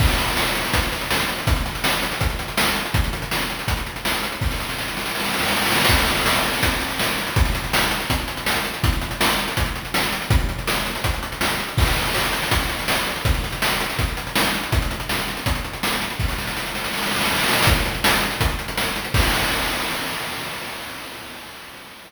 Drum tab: CC |x-------------------------------|--------------------------------|--------------------------------|--------------------------------|
HH |--x-x-x---x-x-x-x-x-x-x---x-x-x-|x-x-x-x---x-x-x-x-x-x-x---x-x-x-|x-x-x-x---x-x-x-x-x-x-x---x-x-x-|--------------------------------|
SD |--------o-----o---------o-------|--------o-----o---------o-------|--------o-----o---------o-------|o-o-o-o-o-o-o-o-oooooooooooooooo|
BD |o---------------o---------------|o---------------o---------------|o---------------o---------------|o-------------------------------|

CC |x-------------------------------|--------------------------------|--------------------------------|--------------------------------|
HH |--x-x-x---x-x-x-x-x-x-x---x-x-x-|x-x-x-x---x-x-x-x-x-x-x---x-x-x-|x-x-x-x---x-x-x-x-x-x-x---x-x-x-|x-x-x-x---x-x-x-x-x-x-x---x-x-x-|
SD |--------o-----o---------o-------|--------o-----o---------o-------|--------o-----o---------o-------|--------o-----o---------o-------|
BD |o---------------o---------------|o---------------o---------------|o---------------o---------------|o---------------o---------------|

CC |x-------------------------------|--------------------------------|--------------------------------|--------------------------------|
HH |--x-x-x---x-x-x-x-x-x-x---x-x-x-|x-x-x-x---x-x-x-x-x-x-x---x-x-x-|x-x-x-x---x-x-x-x-x-x-x---x-x-x-|--------------------------------|
SD |--------o-----o---------o-------|--------o-----o---------o-------|--------o-----o---------o-------|o-o-o-o-o-o-o-o-oooooooooooooooo|
BD |o---------------o---------------|o---------------o---------------|o---------------o---------------|o-------------------------------|

CC |--------------------------------|x-------------------------------|
HH |x-x-x-x---x-x-x-x-x-x-x---x-x-x-|--------------------------------|
SD |--------o-----o---------o-------|--------------------------------|
BD |o---------------o---------------|o-------------------------------|